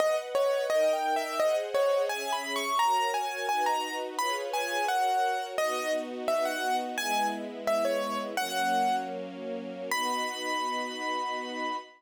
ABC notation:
X:1
M:2/4
L:1/16
Q:1/4=86
K:B
V:1 name="Acoustic Grand Piano"
d z c2 (3d2 =g2 e2 | d z c2 (3g2 b2 c'2 | a2 g2 g a2 z | b z g2 f4 |
d2 z2 e f2 z | g2 z2 e c2 z | "^rit." f4 z4 | b8 |]
V:2 name="String Ensemble 1"
[Bdf]4 [DA=g]4 | [G^Bdf]4 [CGe]4 | [FAc]4 [DFB]4 | [^EGBc]4 [FAc]4 |
[B,DF]8 | [G,B,E]8 | "^rit." [F,A,C]8 | [B,DF]8 |]